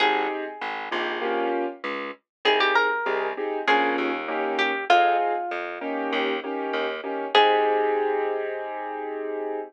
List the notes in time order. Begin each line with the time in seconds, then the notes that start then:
0.00 G#1 C4 D#4 G4 G#4
0.61 G#1
0.91 A#1 C4 D#4 G4 G#4
1.22 A#3 C#4 F4 G4
1.84 C#2
2.45 C2 C4 D#4 G4 G#4
2.60 G4
2.75 A#4
3.06 C2 C4 D#4 G4 G#4
3.37 C4 D#4 G4 G#4
3.67 A#1 A#3 C#4 F4 G#4
3.98 D#2
4.28 A#3 C#4 D#4 G4
4.59 G4
4.90 F2 C4 D#4 F4 G#4
5.51 F2
5.81 A#3 C#4 D#4 G4
6.13 D#2
6.44 A#3 C#4 D#4 G4
6.73 D#2
7.04 A#3 C#4 D#4 G4
7.35 G#2 C4 D#4 G4 G#4